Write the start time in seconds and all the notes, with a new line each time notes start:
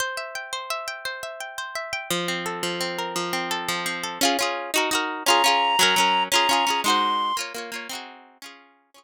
0.00 C5
0.17 E5
0.35 G5
0.53 C5
0.70 E5
0.88 G5
1.05 C5
1.23 E5
1.40 G5
1.58 C5
1.75 E5
1.93 G5
2.10 F3
2.28 C4
2.46 A4
2.63 F3
2.81 C4
2.99 A#4
3.16 F3
3.33 C4
3.51 A4
3.68 F3
3.86 C4
4.04 A4
4.21 C#4 F4 G#4
4.39 C#4 F4 G#4
4.74 D#4 F#4 A#4
4.91 D#4 F#4 A#4
5.26 C#4 F4 A#5
5.30 G#4
5.44 C#4 F4 G#4
5.79 F#3 C#4 A#4
5.96 F#3 C#4 A#4
6.32 C#4 F4 G#4 A#5
6.49 C#4 F4 G#4
6.67 C#4 F4 G#4
6.84 G#3 D#4 F#4 C6
6.90 C5
7.37 A#3 F4 C#5
7.54 A#3 F4 C#5
7.72 A#3 F4 C#5
7.89 C4 D#4 F#4
7.95 G#4
8.42 C#4 F4 G#4
8.94 C#4 F4 G#4 C#6